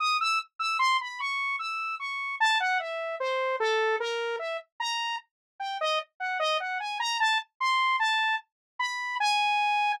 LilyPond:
\new Staff { \time 5/8 \tempo 4 = 75 ees'''16 e'''16 r16 e'''16 c'''16 b''16 des'''8 e'''8 | des'''8 a''16 ges''16 e''8 c''8 a'8 | bes'8 e''16 r16 bes''8 r8 g''16 ees''16 | r16 ges''16 ees''16 ges''16 aes''16 bes''16 a''16 r16 c'''8 |
a''8 r8 b''8 aes''4 | }